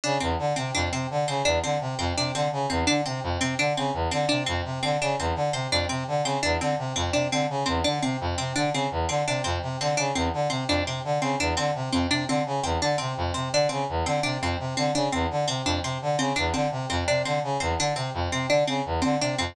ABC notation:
X:1
M:5/4
L:1/8
Q:1/4=169
K:none
V:1 name="Brass Section" clef=bass
_D, E,, =D, C, F,, C, D, _D, E,, =D, | C, F,, C, D, _D, E,, =D, C, F,, C, | D, _D, E,, =D, C, F,, C, D, _D, E,, | D, C, F,, C, D, _D, E,, =D, C, F,, |
C, D, _D, E,, =D, C, F,, C, D, _D, | E,, D, C, F,, C, D, _D, E,, =D, C, | F,, C, D, _D, E,, =D, C, F,, C, D, | _D, E,, =D, C, F,, C, D, _D, E,, =D, |
C, F,, C, D, _D, E,, =D, C, F,, C, | D, _D, E,, =D, C, F,, C, D, _D, E,, | D, C, F,, C, D, _D, E,, =D, C, F,, |]
V:2 name="Harpsichord"
D C z C D C z C D C | z C D C z C D C z C | D C z C D C z C D C | z C D C z C D C z C |
D C z C D C z C D C | z C D C z C D C z C | D C z C D C z C D C | z C D C z C D C z C |
D C z C D C z C D C | z C D C z C D C z C | D C z C D C z C D C |]